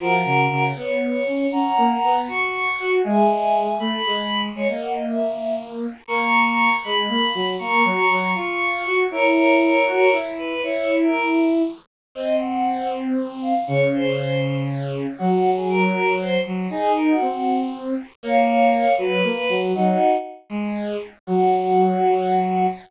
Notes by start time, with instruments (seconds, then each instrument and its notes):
0.00 violin F3, choir aahs F#4 A#4
0.25 violin C#3
0.50 violin C#3
0.76 violin B3, choir aahs C#5
1.26 violin C#4
1.52 violin C#4, choir aahs F#5 A#5
1.77 violin A#3
2.03 violin B3
2.27 violin F#4, choir aahs C#6
2.80 violin F#4
3.04 violin G#3, choir aahs E5 G#5
3.79 violin A3, choir aahs B5
4.06 violin G#3
4.55 violin G#3, choir aahs C#5
4.68 violin A#3, choir aahs D#5
4.81 choir aahs F#5
4.94 choir aahs D#5
5.06 choir aahs E5
6.07 violin A#3, choir aahs A#5 C#6
6.83 violin G#3, choir aahs B5
7.09 violin A#3
7.35 violin F#3
7.59 violin A#3, choir aahs A#5 C#6
7.84 violin F#3
8.10 violin F#3
8.35 violin F4, choir aahs C#6
8.86 violin F#4
9.11 violin E4, choir aahs A#4 C#5
9.86 violin F#4
10.12 violin E4
10.39 choir aahs B4
10.63 violin E4, choir aahs C#5
11.02 choir aahs A#4
12.15 violin C4, choir aahs D#5
12.39 choir aahs F#5
13.42 choir aahs F5
13.67 violin C#3, choir aahs C#5
13.93 choir aahs C5
15.18 violin F#3, choir aahs F#4
15.56 choir aahs G#4
15.69 choir aahs A#4
16.20 choir aahs C5
16.46 violin F#3
16.70 violin D#4, choir aahs G#4
16.97 choir aahs A#4
17.09 choir aahs F#4
17.21 violin C4
18.23 violin A#3, choir aahs C#5 F5
18.98 violin F#3, choir aahs B4
19.24 violin A#3
19.49 violin F#3
19.75 violin F#3, choir aahs D#4 F#4
20.50 violin G#3
21.27 violin F#3, choir aahs F#4